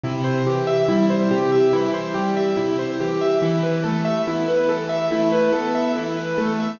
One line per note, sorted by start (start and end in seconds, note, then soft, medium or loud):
0.04 0.42 C3 loud
0.04 0.24 E4 medium
0.24 0.43 C5 medium
0.47 0.85 E3 medium
0.47 0.66 G4 medium
0.67 0.86 E5 medium
0.89 1.27 G3 medium
0.89 1.08 E4 medium
1.10 1.29 C5 medium
1.31 1.69 C3 medium
1.31 1.50 G4 medium
1.52 1.71 E5 medium
1.73 2.11 E3 medium
1.73 1.92 E4 medium
1.94 2.13 C5 medium
2.14 2.53 G3 medium
2.14 2.34 G4 medium
2.37 2.56 E5 medium
2.57 2.96 C3 medium
2.57 2.76 E4 medium
2.79 2.98 C5 medium
3.00 3.38 E3 medium
3.00 3.20 G4 medium
3.21 3.41 E5 medium
3.42 3.80 E3 medium
3.42 3.62 E4 medium
3.63 3.83 B4 medium
3.84 4.23 A3 medium
3.84 4.03 A4 medium
4.05 4.24 E5 medium
4.27 4.65 B3 medium
4.27 4.47 E4 medium
4.48 4.67 B4 medium
4.69 5.07 E3 medium
4.69 4.88 A4 medium
4.89 5.09 E5 medium
5.11 5.49 A3 medium
5.11 5.31 E4 medium
5.32 5.52 B4 medium
5.52 5.91 B3 medium
5.52 5.72 A4 medium
5.75 5.94 E5 medium
5.95 6.33 E3 medium
5.95 6.16 E4 medium
6.17 6.36 B4 medium
6.37 6.76 A3 medium
6.37 6.57 A4 medium
6.60 6.79 E5 medium